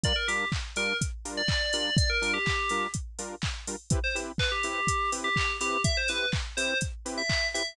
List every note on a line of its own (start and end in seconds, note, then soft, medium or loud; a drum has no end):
0.04 0.13 G3 loud
0.04 0.13 D4 loud
0.04 0.13 F4 loud
0.04 0.13 A#4 loud
0.04 0.16 D5 loud
0.04 kick loud
0.04 closed hi-hat loud
0.16 0.27 A#4 medium
0.28 0.45 G3 medium
0.28 0.45 D4 medium
0.28 0.45 F4 medium
0.28 0.48 G4 medium
0.28 0.45 A#4 medium
0.28 open hi-hat medium
0.52 kick loud
0.52 clap loud
0.76 0.93 G3 loud
0.76 0.93 D4 loud
0.76 0.93 F4 medium
0.76 0.93 A#4 medium
0.76 0.96 A#4 medium
0.76 open hi-hat loud
1.01 kick loud
1.01 closed hi-hat loud
1.25 1.42 G3 medium
1.25 1.42 D4 loud
1.25 1.42 F4 medium
1.25 1.42 A#4 medium
1.25 open hi-hat medium
1.37 1.73 D5 loud
1.48 kick loud
1.48 clap loud
1.73 1.90 G3 medium
1.73 1.90 D4 loud
1.73 1.90 F4 loud
1.73 1.90 A#4 medium
1.73 1.94 D5 medium
1.73 open hi-hat loud
1.97 2.09 D5 loud
1.97 kick loud
1.97 closed hi-hat loud
2.10 2.32 A#4 loud
2.21 2.38 G3 medium
2.21 2.38 D4 loud
2.21 2.38 F4 medium
2.21 2.38 A#4 loud
2.21 open hi-hat medium
2.34 2.83 G4 loud
2.46 kick loud
2.46 clap loud
2.69 2.87 G3 medium
2.69 2.87 D4 medium
2.69 2.87 F4 medium
2.69 2.87 A#4 loud
2.69 open hi-hat medium
2.94 kick loud
2.94 closed hi-hat loud
3.19 3.35 G3 medium
3.19 3.35 D4 medium
3.19 3.35 F4 medium
3.19 3.35 A#4 loud
3.19 open hi-hat loud
3.42 kick loud
3.42 clap loud
3.67 3.76 G3 medium
3.67 3.76 D4 medium
3.67 3.76 F4 medium
3.67 3.76 A#4 medium
3.67 open hi-hat loud
3.90 3.99 C4 loud
3.90 3.99 E4 loud
3.90 3.99 G4 loud
3.90 3.99 B4 loud
3.90 kick loud
3.90 closed hi-hat loud
4.04 4.15 C5 medium
4.15 4.32 C4 medium
4.15 4.32 E4 medium
4.15 4.32 G4 medium
4.15 4.32 B4 medium
4.15 open hi-hat medium
4.38 4.51 B4 loud
4.38 kick loud
4.38 clap loud
4.52 5.10 G4 medium
4.63 4.81 C4 medium
4.63 4.81 E4 loud
4.63 4.81 G4 loud
4.63 4.81 B4 medium
4.63 open hi-hat medium
4.87 kick loud
4.87 closed hi-hat loud
5.12 5.29 C4 medium
5.12 5.29 E4 medium
5.12 5.29 G4 medium
5.12 5.29 B4 loud
5.12 open hi-hat loud
5.24 5.35 G4 loud
5.36 5.57 G4 loud
5.36 kick loud
5.36 clap loud
5.60 5.77 C4 medium
5.60 5.77 E4 medium
5.60 5.77 G4 medium
5.60 5.81 G4 loud
5.60 5.77 B4 medium
5.60 open hi-hat loud
5.84 5.96 E5 loud
5.84 kick loud
5.84 closed hi-hat loud
5.97 6.09 C5 loud
6.08 6.26 C4 medium
6.08 6.26 E4 medium
6.08 6.26 G4 medium
6.08 6.29 B4 loud
6.08 6.26 B4 medium
6.08 open hi-hat medium
6.32 kick loud
6.32 clap loud
6.57 6.74 C4 loud
6.57 6.74 E4 medium
6.57 6.74 G4 medium
6.57 6.74 B4 medium
6.57 6.78 C5 medium
6.57 open hi-hat loud
6.81 kick loud
6.81 closed hi-hat loud
7.05 7.22 C4 loud
7.05 7.22 E4 medium
7.05 7.22 G4 loud
7.05 7.22 B4 medium
7.05 open hi-hat medium
7.18 7.47 E5 loud
7.30 kick loud
7.30 clap loud
7.54 7.63 C4 medium
7.54 7.63 E4 medium
7.54 7.63 G4 medium
7.54 7.63 B4 medium
7.54 7.74 E5 medium
7.54 open hi-hat loud